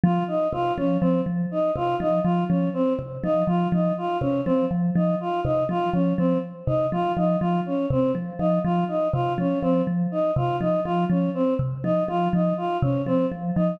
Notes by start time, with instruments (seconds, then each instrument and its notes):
0.04 vibraphone F3, choir aahs F4
0.28 choir aahs D#4
0.53 vibraphone C3, choir aahs F4
0.77 vibraphone F3, choir aahs C#4
1.01 vibraphone F3, choir aahs C4
1.26 vibraphone F3
1.51 choir aahs D#4
1.76 vibraphone C3, choir aahs F4
2.00 vibraphone F3, choir aahs D#4
2.24 vibraphone F3, choir aahs F4
2.49 vibraphone F3, choir aahs C#4
2.74 choir aahs C4
2.99 vibraphone C3
3.24 vibraphone F3, choir aahs D#4
3.47 vibraphone F3, choir aahs F4
3.72 vibraphone F3, choir aahs D#4
3.98 choir aahs F4
4.21 vibraphone C3, choir aahs C#4
4.45 vibraphone F3, choir aahs C4
4.71 vibraphone F3
4.95 vibraphone F3, choir aahs D#4
5.20 choir aahs F4
5.44 vibraphone C3, choir aahs D#4
5.69 vibraphone F3, choir aahs F4
5.93 vibraphone F3, choir aahs C#4
6.18 vibraphone F3, choir aahs C4
6.67 vibraphone C3, choir aahs D#4
6.92 vibraphone F3, choir aahs F4
7.17 vibraphone F3, choir aahs D#4
7.40 vibraphone F3, choir aahs F4
7.66 choir aahs C#4
7.90 vibraphone C3, choir aahs C4
8.15 vibraphone F3
8.39 vibraphone F3, choir aahs D#4
8.64 vibraphone F3, choir aahs F4
8.88 choir aahs D#4
9.13 vibraphone C3, choir aahs F4
9.38 vibraphone F3, choir aahs C#4
9.62 vibraphone F3, choir aahs C4
9.87 vibraphone F3
10.11 choir aahs D#4
10.36 vibraphone C3, choir aahs F4
10.60 vibraphone F3, choir aahs D#4
10.85 vibraphone F3, choir aahs F4
11.10 vibraphone F3, choir aahs C#4
11.34 choir aahs C4
11.59 vibraphone C3
11.84 vibraphone F3, choir aahs D#4
12.08 vibraphone F3, choir aahs F4
12.33 vibraphone F3, choir aahs D#4
12.57 choir aahs F4
12.82 vibraphone C3, choir aahs C#4
13.06 vibraphone F3, choir aahs C4
13.32 vibraphone F3
13.56 vibraphone F3, choir aahs D#4